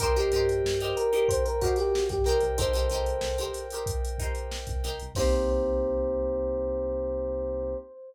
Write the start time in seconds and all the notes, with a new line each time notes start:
0.00 C2 D#4 G4 A#4 C5 D#5 G5, kick, closed hi-hat
0.16 D#4 G4 A#4 C5, closed hi-hat
0.32 G2 D#4 G4 A#4, snare, closed hi-hat
0.36 C5
0.49 closed hi-hat
0.64 G2, snare
0.80 D#4 G4 A#4 C5, closed hi-hat
0.97 A#4, closed hi-hat
1.13 D#4 G4 A#4 C5, closed hi-hat
1.28 C5, kick, closed hi-hat
1.45 A#4, closed hi-hat
1.61 D#4 F#4 G4 A#4 C5, kick, snare, closed hi-hat
1.76 G4, snare, closed hi-hat
1.95 snare
2.08 G2 G4, kick, snare, closed hi-hat
2.24 C2 D#4 G4 A#4 C5 D#5 G5, snare, closed hi-hat
2.29 C5
2.40 C2, closed hi-hat
2.58 C2 D#4 G4 A4 A#4 C5, kick, closed hi-hat
2.73 D#4 G4 A#4 C5, closed hi-hat
2.90 C2 D#4 G4 A#4, snare, closed hi-hat
2.94 C5
3.06 closed hi-hat
3.21 C2, snare
3.38 D#4 G4 A#4 C5, closed hi-hat
3.53 snare, closed hi-hat
3.70 D#4 G4 A#4, closed hi-hat
3.75 C5
3.86 kick, closed hi-hat
4.05 closed hi-hat
4.18 D#4 G4 A#4, kick, closed hi-hat
4.22 C5
4.35 closed hi-hat
4.51 snare
4.67 C2, kick, closed hi-hat
4.84 C2 D#4 G4 A#4 C5, snare, closed hi-hat
4.99 C2, closed hi-hat
5.15 C2 A#3 C4 D#4 G4 A#4 C5, kick, crash
5.20 C5